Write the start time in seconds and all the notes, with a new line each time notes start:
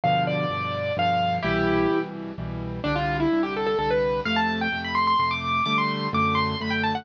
0.04 G2 B2 D3 F3 F5
0.27 D5
0.50 G2 B2 D3 F3
0.97 G2 B2 D3 F3 F5
1.42 C2 B2 E3 G3 E4 G4
1.90 C2 B2 E3 G3
2.38 C2 B2 E3 G3
2.84 C2 D3 G3 D4
2.96 F4
3.20 E4
3.32 C2 D3 G3
3.43 G4
3.56 A4
3.67 A4
3.79 C2 D3 G3 A4
3.91 B4
4.25 F2 C3 A3 F5
4.36 A5
4.61 G5
4.72 F2 C3 A3
4.84 B5
4.95 C6
5.07 C6
5.19 F2 C3 A3 C6
5.31 D6
5.66 D3 G3 A3 D6
5.78 C6
6.13 F#2 D3 A3 D6
6.35 C6
6.60 F#2 D3 A3 B5
6.70 G5
6.83 A5
6.95 F#5